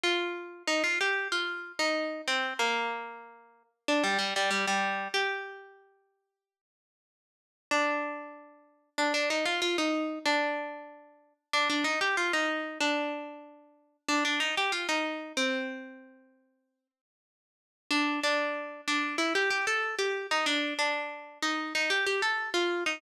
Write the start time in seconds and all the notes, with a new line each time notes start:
0.03 F4
0.67 D#4
0.84 F4
1.01 G4
1.32 F4
1.79 D#4
2.28 C4
2.59 A#3
3.88 D4
4.04 G3
4.18 G3
4.36 G3
4.51 G3
4.67 G3
5.14 G4
7.71 D4
8.98 D4
9.14 D4
9.30 D#4
9.45 F4
9.62 F4
9.78 D#4
10.26 D4
11.53 D4
11.70 D4
11.84 D#4
12.01 G4
12.17 F4
12.33 D#4
12.80 D4
14.09 D4
14.25 D4
14.40 D#4
14.57 G4
14.72 F4
14.89 D#4
15.37 C4
17.91 D4
18.23 D4
18.88 D4
19.18 E4
19.35 G4
19.50 G4
19.67 A4
19.99 G4
20.31 D#4
20.46 D4
20.79 D4
21.42 D#4
21.75 D#4
21.90 G4
22.06 G4
22.22 A4
22.54 F4
22.86 D#4